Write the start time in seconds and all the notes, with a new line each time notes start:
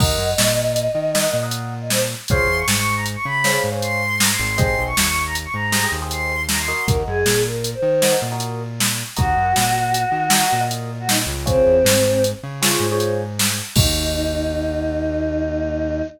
0.00 D#2 A#4 D#5 F#5, kick, crash
0.18 F#2
0.38 A#2, snare
0.76 closed hi-hat
0.95 D#3
1.15 A#4 D#5 F#5, snare
1.24 A#4 D#5 F#5
1.33 A#2
1.43 A#4 D#5 F#5
1.51 closed hi-hat
1.81 D#5
1.90 C5, snare
2.28 C#2 G#4 C5 C#5 F5 C6, kick, closed hi-hat
2.47 E2
2.58 C#6
2.67 G#2 C#6, snare
2.76 C#6
2.96 A#5
3.06 closed hi-hat
3.15 C#6
3.25 C#3 B5
3.44 G#4 C5 C#5 F5, snare
3.53 G#4 C5 C#5 F5
3.64 G#2
3.72 G#4 C5 C#5 F5
3.82 C6, closed hi-hat
4.20 A#5, snare
4.30 C6
4.39 G#1
4.58 G4 G#4 C5 D#5 C6, kick, closed hi-hat
4.78 B1
4.87 C#6
4.96 D#2 C#6, snare
5.05 C#6
5.26 A#5
5.35 closed hi-hat
5.45 C#6
5.54 G#2 A#5
5.72 G4 G#4 C5 D#5, snare
5.84 G4 G#4 C5 D#5
5.92 D#2
6.02 G4 G#4 C5 D#5
6.11 C6, closed hi-hat
6.49 A#5, snare
6.59 C6
6.68 F#4 A#4 D#5
6.87 D#2 A#4, kick, closed hi-hat
7.07 F#2 G#4
7.26 A#2, snare
7.46 A#4
7.64 closed hi-hat
7.74 C5
7.82 D#3
8.02 F#4 A#4 D#5, snare
8.12 F#4 A#4 D#5
8.22 A#2
8.32 F#4 A#4 D#5
8.40 closed hi-hat
8.80 snare
9.16 D#2 F#4 A#4 D#5, kick, closed hi-hat
9.37 F#2
9.56 A#2, snare
9.94 closed hi-hat
10.12 D#3
10.30 F#4 A#4 D#5, snare
10.41 F#4 A#4 D#5
10.52 A#2
10.61 F#4 A#4 D#5
10.71 closed hi-hat
11.00 F#4
11.09 D#4, snare
11.27 C#2
11.46 C4 F4 G#4 C5 C#5, kick, closed hi-hat
11.66 E2
11.84 G#2, snare
12.24 closed hi-hat
12.43 C#3
12.62 F4 G#4 C5 C#5, snare
12.71 F4 G#4 C5 C#5
12.80 G#2
12.91 F4 G#4 C5 C#5
13.00 closed hi-hat
13.39 snare
13.75 D#2 A#3 D#4 F#4, kick, crash